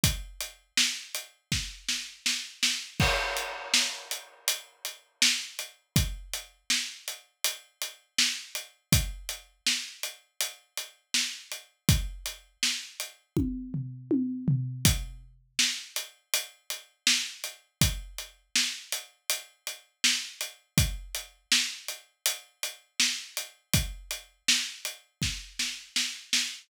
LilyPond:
\new DrumStaff \drummode { \time 4/4 \tempo 4 = 81 <hh bd>8 hh8 sn8 hh8 <bd sn>8 sn8 sn8 sn8 | <cymc bd>8 hh8 sn8 hh8 hh8 hh8 sn8 hh8 | <hh bd>8 hh8 sn8 hh8 hh8 hh8 sn8 hh8 | <hh bd>8 hh8 sn8 hh8 hh8 hh8 sn8 hh8 |
<hh bd>8 hh8 sn8 hh8 <bd tommh>8 tomfh8 tommh8 tomfh8 | <hh bd>4 sn8 hh8 hh8 hh8 sn8 hh8 | <hh bd>8 hh8 sn8 hh8 hh8 hh8 sn8 hh8 | <hh bd>8 hh8 sn8 hh8 hh8 hh8 sn8 hh8 |
<hh bd>8 hh8 sn8 hh8 <bd sn>8 sn8 sn8 sn8 | }